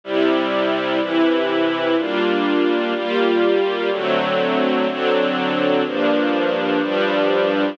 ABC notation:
X:1
M:4/4
L:1/8
Q:1/4=124
K:Gdor
V:1 name="String Ensemble 1"
[C,G,E]4 [C,E,E]4 | [G,B,DF]4 [G,B,FG]4 | [D,^F,A,C]4 [D,F,CD]4 | [G,,F,B,D]4 [G,,F,G,D]4 |]